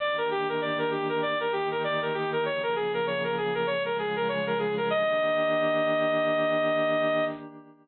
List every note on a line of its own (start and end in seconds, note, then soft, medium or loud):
0.00 1.22 D#3 medium
0.00 1.22 A#3 medium
0.00 1.22 D4 medium
0.00 1.22 G4 medium
0.00 0.16 D5 medium
0.18 0.29 A#4 medium
0.31 0.47 G4 medium
0.49 0.60 A#4 medium
0.61 0.78 D5 medium
0.78 0.90 A#4 medium
0.91 1.08 G4 medium
1.09 1.21 A#4 medium
1.22 2.44 D#3 medium
1.22 2.44 A#3 medium
1.22 2.44 D#4 medium
1.22 2.44 G4 medium
1.22 1.38 D5 medium
1.40 1.52 A#4 medium
1.52 1.69 G4 medium
1.71 1.83 A#4 medium
1.84 2.00 D5 medium
2.02 2.13 A#4 medium
2.14 2.30 G4 medium
2.32 2.44 A#4 medium
2.45 3.66 C#3 medium
2.45 3.66 F3 medium
2.45 3.66 A#3 medium
2.45 3.66 G#4 medium
2.45 2.62 C#5 medium
2.63 2.75 A#4 medium
2.76 2.92 G#4 medium
2.94 3.05 A#4 medium
3.07 3.23 C#5 medium
3.24 3.36 A#4 medium
3.37 3.54 G#4 medium
3.55 3.66 A#4 medium
3.67 4.89 C#3 loud
3.67 4.89 F3 medium
3.67 4.89 G#3 medium
3.67 4.89 G#4 loud
3.67 3.83 C#5 medium
3.85 3.97 A#4 medium
3.99 4.15 G#4 medium
4.16 4.28 A#4 medium
4.28 4.45 C#5 medium
4.47 4.58 A#4 medium
4.59 4.75 G#4 medium
4.77 4.89 A#4 medium
4.90 7.24 D#3 loud
4.90 7.24 A#3 loud
4.90 7.24 D4 loud
4.90 7.24 G4 medium
4.90 7.25 D#5 loud